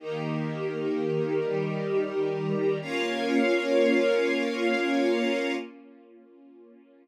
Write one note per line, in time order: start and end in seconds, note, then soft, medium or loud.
0.00 1.39 D#3 loud
0.00 1.39 A#3 medium
0.00 2.78 D#4 medium
0.00 1.39 G4 loud
0.00 2.78 G4 medium
0.00 2.78 A#4 medium
1.41 2.80 D#3 medium
1.41 2.80 G3 medium
1.41 2.80 G4 loud
2.81 5.54 A#3 loud
2.81 5.54 C#4 loud
2.81 5.54 F4 loud
2.81 5.54 A#4 loud
2.81 5.54 C#5 loud
2.81 5.54 F5 loud